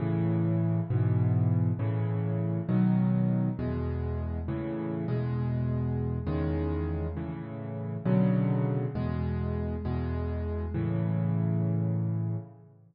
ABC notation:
X:1
M:6/8
L:1/8
Q:3/8=67
K:A
V:1 name="Acoustic Grand Piano" clef=bass
[A,,C,E,]3 [G,,B,,E,]3 | [A,,C,E,]3 [B,,^D,F,]3 | [E,,B,,G,]3 [A,,C,E,]2 [E,,B,,G,]- | [E,,B,,G,]3 [E,,C,^D,G,]3 |
[A,,C,E,]3 [B,,C,D,F,]3 | [E,,B,,G,]3 [E,,B,,G,]3 | [A,,C,E,]6 |]